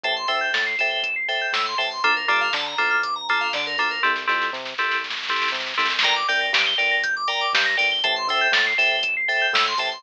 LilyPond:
<<
  \new Staff \with { instrumentName = "Electric Piano 2" } { \time 4/4 \key g \dorian \tempo 4 = 120 <a' c'' e'' g''>8 <a' c'' e'' g''>4 <a' c'' e'' g''>4 <a' c'' e'' g''>4 <a' c'' e'' g''>8 | <bes d' f' a'>8 <bes d' f' a'>4 <bes d' f' a'>4 <bes d' f' a'>4 <bes d' f' a'>8 | <c' e' g' a'>8 <c' e' g' a'>4 <c' e' g' a'>4 <c' e' g' a'>4 <c' e' g' a'>8 | <bes' d'' g''>8 <bes' d'' g''>4 <bes' d'' g''>4 <bes' d'' g''>4 <bes' d'' g''>8 |
<a' c'' e'' g''>8 <a' c'' e'' g''>4 <a' c'' e'' g''>4 <a' c'' e'' g''>4 <a' c'' e'' g''>8 | }
  \new Staff \with { instrumentName = "Electric Piano 2" } { \time 4/4 \key g \dorian a''16 c'''16 e'''16 g'''16 a'''16 c''''16 e''''16 g''''16 e''''16 c''''16 a'''16 g'''16 e'''16 c'''16 a''16 c'''16 | a'16 bes'16 d''16 f''16 a''16 bes''16 d'''16 f'''16 d'''16 bes''16 a''16 f''16 d''16 bes'16 a'16 bes'16 | r1 | bes''16 d'''16 g'''16 bes'''16 d''''16 g''''16 d''''16 bes'''16 g'''16 d'''16 bes''16 d'''16 g'''16 bes'''16 d''''16 g''''16 |
a''16 c'''16 e'''16 g'''16 a'''16 c''''16 e''''16 g''''16 e''''16 c''''16 a'''16 g'''16 e'''16 c'''16 a''16 c'''16 | }
  \new Staff \with { instrumentName = "Synth Bass 1" } { \clef bass \time 4/4 \key g \dorian a,,8 d,8 a,8 a,,4. a,8 a,,8 | d,8 g,8 d8 d,4. d8 d,8 | c,8 f,8 c8 c,4. c8 c,8 | g,,8 c,8 g,8 g,,4. g,8 g,,8 |
a,,8 d,8 a,8 a,,4. a,8 a,,8 | }
  \new DrumStaff \with { instrumentName = "Drums" } \drummode { \time 4/4 <hh bd>8 hho8 <bd sn>8 hho8 <hh bd>8 hho8 <bd sn>8 hho8 | <hh bd>8 hho8 <bd sn>8 hho8 <hh bd>8 hho8 <bd sn>8 hho8 | <bd sn>16 sn16 sn16 sn16 sn16 sn16 sn16 sn16 sn32 sn32 sn32 sn32 sn32 sn32 sn32 sn32 sn32 sn32 sn32 sn32 sn32 sn32 sn32 sn32 | <hh bd>8 hho8 <bd sn>8 hho8 <hh bd>8 hho8 <bd sn>8 hho8 |
<hh bd>8 hho8 <bd sn>8 hho8 <hh bd>8 hho8 <bd sn>8 hho8 | }
>>